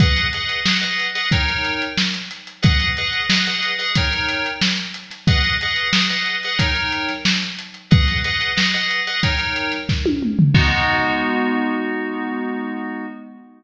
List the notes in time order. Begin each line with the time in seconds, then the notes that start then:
0.00 G#4 B4 D#5 F#5, kick, closed hi-hat
0.16 closed hi-hat
0.33 G#4 B4 D#5 F#5, closed hi-hat
0.49 closed hi-hat
0.65 G#4 B4 D#5 F#5, snare
0.81 G#4 B4 D#5 F#5, closed hi-hat
0.99 closed hi-hat
1.15 G#4 B4 D#5 F#5, closed hi-hat
1.31 D#4 A#4 C#5 G5, kick, closed hi-hat
1.48 closed hi-hat
1.64 snare, closed hi-hat
1.82 closed hi-hat
1.98 snare
2.14 closed hi-hat
2.31 snare, closed hi-hat
2.47 closed hi-hat
2.62 G#4 B4 D#5 F#5, kick, closed hi-hat
2.80 closed hi-hat
2.97 G#4 B4 D#5 F#5, closed hi-hat
3.13 closed hi-hat
3.30 G#4 B4 D#5 F#5, snare
3.46 G#4 B4 D#5 F#5, closed hi-hat
3.63 closed hi-hat
3.79 G#4 B4 D#5 F#5, closed hi-hat
3.95 D#4 A#4 C#5 G5, kick, closed hi-hat
4.13 closed hi-hat
4.29 closed hi-hat
4.46 closed hi-hat
4.61 snare
4.77 closed hi-hat
4.94 closed hi-hat
5.11 snare, closed hi-hat
5.27 G#4 B4 D#5 F#5, kick, closed hi-hat
5.44 closed hi-hat
5.61 G#4 B4 D#5 F#5, closed hi-hat
5.76 closed hi-hat
5.93 G#4 B4 D#5 F#5, snare
6.10 G#4 B4 D#5 F#5, closed hi-hat
6.26 closed hi-hat
6.43 G#4 B4 D#5 F#5, closed hi-hat
6.59 D#4 A#4 C#5 G5, kick, closed hi-hat
6.75 closed hi-hat
6.92 closed hi-hat
7.09 snare, closed hi-hat
7.25 snare
7.42 closed hi-hat
7.59 closed hi-hat
7.74 closed hi-hat
7.91 G#4 B4 D#5 F#5, kick, closed hi-hat
8.08 snare, closed hi-hat
8.24 G#4 B4 D#5 F#5, closed hi-hat
8.41 closed hi-hat
8.56 G#4 B4 D#5 F#5, snare
8.74 G#4 B4 D#5 F#5, closed hi-hat
8.91 closed hi-hat
9.07 G#4 B4 D#5 F#5, closed hi-hat
9.23 D#4 A#4 C#5 G5, kick, closed hi-hat
9.39 closed hi-hat
9.56 closed hi-hat
9.72 snare, closed hi-hat
9.89 kick, snare
10.06 high tom
10.23 mid tom
10.39 floor tom
10.54 G#3 B3 D#4 F#4, kick, crash